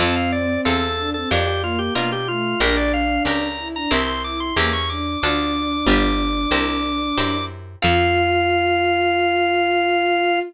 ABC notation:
X:1
M:4/4
L:1/16
Q:1/4=92
K:F
V:1 name="Drawbar Organ"
a f d2 A3 A G G F G F G F2 | B d f2 b3 b c' c' d' c' d' ^c' d'2 | d'14 z2 | f16 |]
V:2 name="Violin"
C6 D C z2 B,2 B, z A,2 | D6 E D z2 E2 B, z D2 | D14 z2 | F16 |]
V:3 name="Acoustic Guitar (steel)"
[CFA]4 [CFA]4 [DFB]4 [DFB]4 | [DGB]4 [DGB]4 [CEGB]4 [^CEGB]4 | [DFA]4 [DFG=B]4 [EG_Bc]4 [EGBc]4 | [CFA]16 |]
V:4 name="Electric Bass (finger)" clef=bass
F,,4 E,,4 F,,4 =B,,4 | B,,,4 ^C,,4 =C,,4 E,,4 | D,,4 G,,,4 C,,4 _G,,4 | F,,16 |]